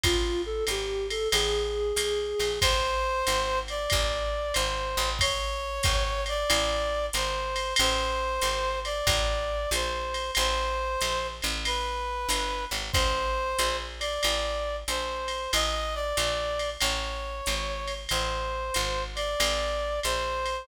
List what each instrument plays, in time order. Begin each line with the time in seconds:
0.03 electric bass (finger) A1, flute F4, kick, ride
0.46 flute A4
0.67 electric bass (finger) G#1, flute G4, hi-hat pedal, ride
1.10 flute A4, ride
1.32 electric bass (finger) A1, flute G#4, ride
1.96 electric bass (finger) B1, hi-hat pedal, ride
2.39 electric bass (finger) A#1, ride
2.61 electric bass (finger) A1, brass section C5, kick, ride
3.27 electric bass (finger) G#1, hi-hat pedal, ride
3.68 brass section D5, ride
3.90 electric bass (finger) A1, kick, ride
4.54 electric bass (finger) G#1, brass section C5, hi-hat pedal, ride
4.97 electric bass (finger) A1, ride
5.19 brass section C#5, kick, ride
5.83 electric bass (finger) G#1, kick, hi-hat pedal, ride
6.26 brass section D5, ride
6.50 electric bass (finger) A1, ride
7.13 electric bass (finger) G#1, brass section C5, hi-hat pedal, ride
7.56 ride
7.76 electric bass (finger) A1, brass section C5, ride
8.41 electric bass (finger) G#1, hi-hat pedal, ride
8.85 brass section D5, ride
9.07 electric bass (finger) A1, kick, ride
9.71 electric bass (finger) A#1, brass section C5, hi-hat pedal, ride
10.14 ride
10.35 electric bass (finger) A1, brass section C5, ride
11.01 electric bass (finger) A#1, hi-hat pedal, ride
11.42 electric bass (finger) A1, ride
11.65 brass section B4, ride
12.29 electric bass (finger) G1, hi-hat pedal, ride
12.71 electric bass (finger) G#1, ride
12.93 electric bass (finger) A1, brass section C5, kick, ride
13.58 electric bass (finger) A#1, hi-hat pedal, ride
14.00 brass section D5, ride
14.23 electric bass (finger) A1, ride
14.88 electric bass (finger) A#1, brass section C5, hi-hat pedal, ride
15.28 ride
15.53 electric bass (finger) A1, brass section D#5, ride
15.95 brass section D5
16.17 electric bass (finger) A#1, hi-hat pedal, ride
16.59 ride
16.81 electric bass (finger) A1, brass section C#5, ride
17.46 electric bass (finger) G#1, hi-hat pedal, ride
17.87 ride
18.09 electric bass (finger) A1, brass section C5, ride
18.74 electric bass (finger) G#1, hi-hat pedal, ride
19.15 brass section D5, ride
19.40 electric bass (finger) A1, ride
20.03 electric bass (finger) A#1, brass section C5, hi-hat pedal, ride
20.46 ride